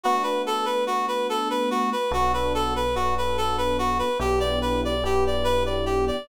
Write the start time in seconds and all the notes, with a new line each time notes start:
0.03 A3 B3 D4 F#4
0.23 B4
0.46 A4
0.65 B4
0.87 F#4
1.08 B4
1.29 A4
1.50 B4
1.71 F#4
1.92 B4
2.11 B1 B3 D4 F#4 A4
2.34 B4
2.55 A4
2.76 B4
2.95 B3 D4 F#4 A4
3.18 B4
3.37 A4
3.58 B4
3.79 F#4
3.99 B4
4.19 B1 B3 D4 E4 G4
4.40 D5
4.62 B4
4.85 D5
5.03 B3 D4 E4 G4
5.27 D5
5.44 B4
5.66 D5
5.86 G4
6.07 D5